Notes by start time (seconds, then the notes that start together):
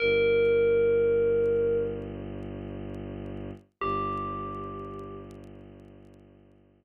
0.00 G1 A#4
3.81 G1 G4